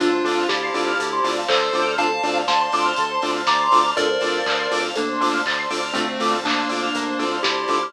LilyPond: <<
  \new Staff \with { instrumentName = "Lead 1 (square)" } { \time 4/4 \key d \minor \tempo 4 = 121 <d' f'>4 <e' g'>2 <a' c''>4 | <f'' a''>4 <a'' c'''>2 <bes'' d'''>4 | <bes' d''>2 <bes d'>4 r4 | <a c'>4 <bes d'>2 <e' g'>4 | }
  \new Staff \with { instrumentName = "Lead 2 (sawtooth)" } { \time 4/4 \key d \minor <c' d' f' a'>8 <c' d' f' a'>4 <c' d' f' a'>4 <c' d' f' a'>4 <c' d' f' a'>8 | <c' d' f' a'>8 <c' d' f' a'>4 <c' d' f' a'>4 <c' d' f' a'>4 <c' d' f' a'>8 | <c' d' f' a'>8 <c' d' f' a'>4 <c' d' f' a'>4 <c' d' f' a'>4 <c' d' f' a'>8 | <c' d' f' a'>8 <c' d' f' a'>4 <c' d' f' a'>4 <c' d' f' a'>4 <c' d' f' a'>8 | }
  \new Staff \with { instrumentName = "Lead 1 (square)" } { \time 4/4 \key d \minor a'16 c''16 d''16 f''16 a''16 c'''16 d'''16 f'''16 a'16 c''16 d''16 f''16 a''16 c'''16 d'''16 f'''16 | a'16 c''16 d''16 f''16 a''16 c'''16 d'''16 f'''16 a'16 c''16 d''16 f''16 a''16 c'''16 d'''16 f'''16 | a'16 c''16 d''16 f''16 a''16 c'''16 d'''16 f'''16 a'16 c''16 d''16 f''16 a''16 c'''16 d'''16 f'''16 | a'16 c''16 d''16 f''16 a''16 c'''16 d'''16 f'''16 bes'16 c''16 d''16 f''16 a''16 c'''16 d'''16 f'''16 | }
  \new Staff \with { instrumentName = "Synth Bass 1" } { \clef bass \time 4/4 \key d \minor d,8 d,8 d,8 d,8 d,8 d,8 d,8 d,8~ | d,8 d,8 d,8 d,8 d,8 d,8 d,8 d,8 | d,8 d,8 d,8 d,8 d,8 d,8 d,8 d,8 | d,8 d,8 d,8 d,8 d,8 d,8 d,8 d,8 | }
  \new Staff \with { instrumentName = "Pad 2 (warm)" } { \time 4/4 \key d \minor <c'' d'' f'' a''>2 <c'' d'' a'' c'''>2 | <c'' d'' f'' a''>2 <c'' d'' a'' c'''>2 | <c'' d'' f'' a''>2 <c'' d'' a'' c'''>2 | <c'' d'' f'' a''>2 <c'' d'' a'' c'''>2 | }
  \new DrumStaff \with { instrumentName = "Drums" } \drummode { \time 4/4 <hh bd>8 hho8 <bd sn>8 hho8 <hh bd>8 hho8 <hc bd>8 hho8 | <hh bd>8 hho8 <bd sn>8 hho8 <hh bd>8 hho8 <bd sn>8 hho8 | <hh bd>8 hho8 <hc bd>8 hho8 <hh bd>8 hho8 <hc bd>8 hho8 | <hh bd>8 hho8 <hc bd>8 hho8 <hh bd>8 hho8 <bd sn>8 hho8 | }
>>